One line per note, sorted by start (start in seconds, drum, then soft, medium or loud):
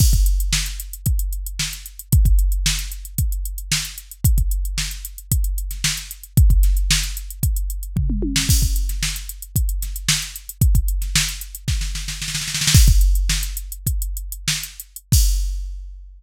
0.00 kick loud
0.00 crash loud
0.13 kick medium
0.13 closed hi-hat medium
0.26 closed hi-hat medium
0.40 closed hi-hat medium
0.53 snare loud
0.66 closed hi-hat medium
0.80 closed hi-hat medium
0.93 closed hi-hat medium
1.06 kick medium
1.06 closed hi-hat medium
1.19 closed hi-hat medium
1.33 closed hi-hat medium
1.46 closed hi-hat medium
1.59 snare loud
1.73 closed hi-hat medium
1.86 closed hi-hat medium
1.99 closed hi-hat medium
2.12 kick loud
2.12 closed hi-hat loud
2.25 kick medium
2.25 closed hi-hat medium
2.39 closed hi-hat medium
2.52 closed hi-hat medium
2.66 snare loud
2.79 closed hi-hat medium
2.92 closed hi-hat medium
3.05 closed hi-hat medium
3.18 kick medium
3.18 closed hi-hat loud
3.32 closed hi-hat medium
3.45 closed hi-hat medium
3.58 closed hi-hat medium
3.72 snare loud
3.85 closed hi-hat medium
3.98 closed hi-hat medium
4.12 closed hi-hat medium
4.24 kick loud
4.24 closed hi-hat loud
4.38 kick medium
4.38 closed hi-hat medium
4.51 closed hi-hat medium
4.65 closed hi-hat medium
4.78 snare medium
4.91 closed hi-hat medium
5.05 closed hi-hat medium
5.18 closed hi-hat medium
5.32 kick medium
5.32 closed hi-hat loud
5.44 closed hi-hat medium
5.58 closed hi-hat medium
5.71 snare soft
5.71 closed hi-hat medium
5.84 snare loud
5.97 snare soft
5.97 closed hi-hat medium
6.11 closed hi-hat medium
6.23 closed hi-hat medium
6.37 kick loud
6.37 closed hi-hat loud
6.50 kick medium
6.50 closed hi-hat medium
6.63 snare soft
6.63 closed hi-hat medium
6.77 closed hi-hat medium
6.91 snare loud
7.03 closed hi-hat medium
7.17 closed hi-hat medium
7.30 closed hi-hat medium
7.43 kick medium
7.43 closed hi-hat loud
7.56 closed hi-hat medium
7.70 closed hi-hat medium
7.83 closed hi-hat medium
7.96 kick medium
7.96 floor tom medium
8.10 mid tom medium
8.22 high tom medium
8.36 snare loud
8.49 kick loud
8.49 crash loud
8.62 kick medium
8.62 closed hi-hat medium
8.76 closed hi-hat medium
8.89 snare soft
8.89 closed hi-hat medium
9.03 snare loud
9.16 closed hi-hat medium
9.29 closed hi-hat medium
9.42 closed hi-hat medium
9.56 kick medium
9.56 closed hi-hat loud
9.69 closed hi-hat medium
9.82 snare soft
9.82 closed hi-hat medium
9.96 closed hi-hat medium
10.09 snare loud
10.22 closed hi-hat medium
10.36 closed hi-hat medium
10.49 closed hi-hat medium
10.61 kick loud
10.61 closed hi-hat loud
10.75 kick medium
10.75 closed hi-hat medium
10.88 closed hi-hat medium
11.02 snare soft
11.02 closed hi-hat medium
11.15 snare loud
11.29 closed hi-hat medium
11.41 closed hi-hat medium
11.55 closed hi-hat medium
11.68 kick medium
11.68 snare medium
11.81 snare medium
11.95 snare medium
12.08 snare medium
12.22 snare medium
12.28 snare medium
12.35 snare medium
12.41 snare medium
12.48 snare medium
12.55 snare medium
12.61 snare loud
12.67 snare loud
12.74 kick loud
12.74 crash loud
12.88 kick loud
12.88 closed hi-hat medium
13.01 closed hi-hat medium
13.15 closed hi-hat medium
13.29 snare loud
13.43 closed hi-hat medium
13.57 closed hi-hat medium
13.72 closed hi-hat medium
13.87 kick medium
13.87 closed hi-hat loud
14.02 closed hi-hat medium
14.17 closed hi-hat medium
14.32 closed hi-hat medium
14.48 snare loud
14.63 closed hi-hat medium
14.80 closed hi-hat medium
14.96 closed hi-hat medium
15.12 kick loud
15.12 crash loud